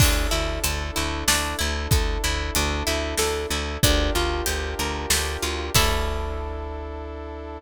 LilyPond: <<
  \new Staff \with { instrumentName = "Orchestral Harp" } { \time 3/4 \key d \major \tempo 4 = 94 d'8 e'8 a'8 e'8 d'8 e'8 | a'8 e'8 d'8 e'8 a'8 e'8 | d'8 f'8 g'8 bes'8 g'8 f'8 | <d' e' a'>2. | }
  \new Staff \with { instrumentName = "Electric Bass (finger)" } { \clef bass \time 3/4 \key d \major d,8 d,8 d,8 d,8 d,8 d,8 | d,8 d,8 d,8 d,8 d,8 d,8 | d,8 d,8 d,8 d,8 d,8 d,8 | d,2. | }
  \new Staff \with { instrumentName = "Brass Section" } { \time 3/4 \key d \major <d' e' a'>2.~ | <d' e' a'>2. | <d' f' g' bes'>2. | <d' e' a'>2. | }
  \new DrumStaff \with { instrumentName = "Drums" } \drummode { \time 3/4 <cymc bd>4 hh4 sn4 | <hh bd>4 hh4 sn4 | <hh bd>4 hh4 sn4 | <cymc bd>4 r4 r4 | }
>>